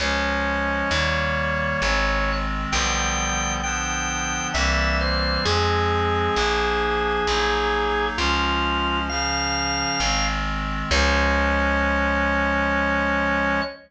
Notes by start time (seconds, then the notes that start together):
0.00 C#2 F3 G#3 C#4 C#5
0.91 D#2 D#3 G3 A#3
1.82 G#1 D#3 G#3 C4
2.71 B1 D3 F3 G3 B3 G5
3.62 D3 F3 B3 D4 G5
4.54 C2 E3 G3 A#3 C4 E5
5.01 C5
5.45 F2 F3 G#3 C4 G#4
6.35 A#1 F3 A#3 D4
7.27 A#1 F#3 A#3 D#4
8.18 C#2 F3 G#3 C#4 F4
9.09 C#3 F3 C#4 F5
10.00 G#1 D#3 G#3 C4
10.91 C#2 F3 G#3 C#4 C#5